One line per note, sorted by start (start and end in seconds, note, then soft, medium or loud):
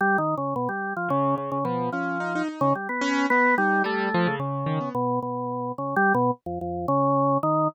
0.01 0.17 G3 loud
0.18 0.35 D#3 medium
0.38 0.54 C#3 medium
0.56 0.68 B2 medium
0.69 0.93 G3 medium
0.97 1.09 F3 medium
1.08 1.58 C#3 medium
1.08 1.35 C#3 loud
1.38 1.50 C#3 medium
1.52 1.64 C#3 medium
1.65 1.90 B2 medium
1.65 1.89 F3 medium
1.92 2.42 F3 medium
1.92 2.18 C#4 medium
2.20 2.33 D#4 medium
2.35 2.48 D#4 medium
2.49 2.73 D#4 medium
2.61 2.73 C#3 loud
2.75 2.88 G3 soft
2.89 3.26 B3 medium
3.01 3.26 C#4 loud
3.30 3.55 B3 loud
3.30 3.56 B3 medium
3.58 3.83 G3 loud
3.58 3.83 D#4 medium
3.84 4.09 G3 loud
3.84 4.35 A3 medium
4.14 4.27 F3 loud
4.27 4.39 C#3 loud
4.39 4.64 C#3 medium
4.39 4.89 C#3 medium
4.66 4.79 D#3 medium
4.81 4.93 B3 medium
4.95 5.19 B2 medium
5.22 5.72 B2 medium
5.78 5.95 C#3 medium
5.96 6.13 G3 loud
6.14 6.31 B2 loud
6.46 6.59 F2 medium
6.61 6.86 F2 medium
6.88 7.38 C#3 loud
7.43 7.68 D#3 loud